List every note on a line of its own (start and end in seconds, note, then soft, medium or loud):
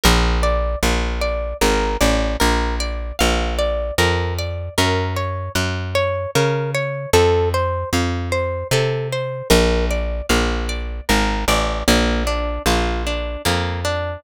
0.04 0.76 A#1 medium
0.04 0.39 A#4 loud
0.43 0.78 D5 medium
0.83 1.54 A#1 medium
0.83 1.18 F5 medium
1.21 1.57 D5 medium
1.61 1.97 G#1 medium
1.61 1.97 A#4 medium
2.00 2.37 A1 medium
2.00 2.36 D5 medium
2.40 3.12 A#1 medium
2.40 2.75 A#4 medium
2.80 3.16 D5 medium
3.19 3.91 A#1 medium
3.19 3.54 F5 medium
3.59 3.94 D5 medium
3.98 4.69 F2 medium
3.98 4.34 A#4 loud
4.38 4.74 D5 medium
4.78 5.49 F#2 medium
4.78 5.13 A#4 loud
5.16 5.52 C#5 medium
5.55 6.26 F#2 medium
5.55 5.91 F#5 medium
5.95 6.31 C#5 medium
6.35 7.06 C#3 medium
6.35 6.71 A#4 medium
6.75 7.10 C#5 medium
7.13 7.84 F2 medium
7.13 7.49 A4 loud
7.54 7.89 C5 medium
7.93 8.64 F2 medium
7.93 8.29 F5 medium
8.32 8.67 C5 medium
8.71 9.42 C3 medium
8.71 9.08 A4 medium
9.13 9.48 C5 medium
9.50 10.22 A#1 medium
9.50 9.85 A#4 loud
9.90 10.26 D5 medium
10.29 11.01 A#1 medium
10.29 10.65 F5 medium
10.69 11.04 D5 medium
11.09 11.45 G#1 medium
11.09 11.44 A#4 medium
11.48 11.83 A1 medium
11.48 11.84 D5 medium
11.88 12.59 A#1 medium
11.88 12.23 A#3 loud
12.27 12.62 D4 medium
12.66 13.37 A#1 medium
12.66 13.03 F4 medium
13.07 13.42 D4 medium
13.45 14.17 F2 medium
13.45 13.81 A#3 medium
13.85 14.20 D4 medium